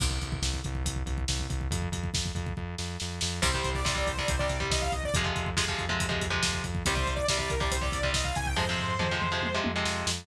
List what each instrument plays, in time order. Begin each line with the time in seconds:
0.00 synth bass 1 C2, kick, crash
0.11 kick
0.21 synth bass 1 C2, kick, closed hi-hat
0.32 kick
0.42 synth bass 1 C2, kick, snare
0.54 kick
0.64 synth bass 1 C2, kick, closed hi-hat
0.75 kick
0.84 synth bass 1 C2, kick, closed hi-hat
0.96 kick
1.06 synth bass 1 C2, kick, closed hi-hat
1.18 kick
1.28 synth bass 1 C2, kick, snare
1.40 kick
1.49 synth bass 1 C2, kick, closed hi-hat
1.61 kick
1.71 synth bass 1 F2, kick, closed hi-hat
1.82 kick
1.92 synth bass 1 F2, kick, closed hi-hat
2.03 kick
2.14 synth bass 1 F2, kick, snare
2.26 kick
2.35 synth bass 1 F2, kick, closed hi-hat
2.47 kick
2.57 synth bass 1 F2, kick
2.78 synth bass 1 F2, snare
3.00 synth bass 1 F2, snare
3.21 synth bass 1 F2, snare
3.42 synth bass 1 C2, overdriven guitar C3 G3, lead 2 (sawtooth) C5, kick, crash
3.54 overdriven guitar C3 G3, kick
3.64 synth bass 1 C2, kick, closed hi-hat
3.75 lead 2 (sawtooth) D5, kick
3.85 synth bass 1 C2, overdriven guitar C3 G3, lead 2 (sawtooth) D5, kick, snare
3.95 overdriven guitar C3 G3, lead 2 (sawtooth) D5, kick
4.06 synth bass 1 C2, lead 2 (sawtooth) C5, kick, closed hi-hat
4.18 overdriven guitar C3 G3, lead 2 (sawtooth) D5, kick
4.28 synth bass 1 C2, lead 2 (sawtooth) C5, kick, closed hi-hat
4.39 overdriven guitar C3 G3, lead 2 (sawtooth) D5, kick
4.49 synth bass 1 C2, kick, closed hi-hat
4.60 overdriven guitar C3 G3, kick
4.70 synth bass 1 C2, lead 2 (sawtooth) D#5, kick, snare
4.82 lead 2 (sawtooth) F5, kick
4.92 synth bass 1 C2, lead 2 (sawtooth) D#5, kick, closed hi-hat
5.04 lead 2 (sawtooth) D5, kick
5.14 synth bass 1 F2, overdriven guitar C3 F3 G#3, kick, closed hi-hat
5.24 overdriven guitar C3 F3 G#3, kick
5.36 synth bass 1 F2, kick, closed hi-hat
5.46 kick
5.56 synth bass 1 F2, overdriven guitar C3 F3 G#3, kick, snare
5.68 overdriven guitar C3 F3 G#3, kick
5.78 synth bass 1 F2, kick, closed hi-hat
5.89 overdriven guitar C3 F3 G#3, kick
6.00 synth bass 1 F2, kick, closed hi-hat
6.09 overdriven guitar C3 F3 G#3, kick
6.21 synth bass 1 F2, kick, closed hi-hat
6.30 overdriven guitar C3 F3 G#3, kick
6.43 synth bass 1 F2, kick, snare
6.53 kick
6.64 synth bass 1 F2, kick, closed hi-hat
6.75 kick
6.86 synth bass 1 C2, overdriven guitar C3 G3, lead 2 (sawtooth) C5, kick, closed hi-hat
6.95 overdriven guitar C3 G3, kick
7.06 synth bass 1 C2, kick, closed hi-hat
7.16 lead 2 (sawtooth) D5, kick
7.28 synth bass 1 C2, overdriven guitar C3 G3, lead 2 (sawtooth) D5, kick, snare
7.38 overdriven guitar C3 G3, lead 2 (sawtooth) D5, kick
7.50 synth bass 1 C2, lead 2 (sawtooth) A#4, kick, closed hi-hat
7.60 overdriven guitar C3 G3, lead 2 (sawtooth) D5, kick
7.71 synth bass 1 C2, lead 2 (sawtooth) C5, kick, closed hi-hat
7.81 overdriven guitar C3 G3, lead 2 (sawtooth) D5, kick
7.92 synth bass 1 C2, kick, closed hi-hat
8.03 overdriven guitar C3 G3, kick
8.13 synth bass 1 C2, lead 2 (sawtooth) D#5, kick, snare
8.24 lead 2 (sawtooth) F5, kick
8.35 synth bass 1 C2, lead 2 (sawtooth) G#5, kick, closed hi-hat
8.46 lead 2 (sawtooth) G5, kick
8.56 synth bass 1 F2, overdriven guitar C3 F3 G#3, lead 2 (sawtooth) C5, kick, floor tom
8.69 overdriven guitar C3 F3 G#3
8.78 synth bass 1 F2, floor tom
8.99 synth bass 1 F2, overdriven guitar C3 F3 G#3, mid tom
9.11 overdriven guitar C3 F3 G#3
9.22 synth bass 1 F2, mid tom
9.32 overdriven guitar C3 F3 G#3
9.42 synth bass 1 F2, high tom
9.54 overdriven guitar C3 F3 G#3
9.64 synth bass 1 F2, high tom
9.76 overdriven guitar C3 F3 G#3
9.85 synth bass 1 F2, snare
10.06 synth bass 1 F2, snare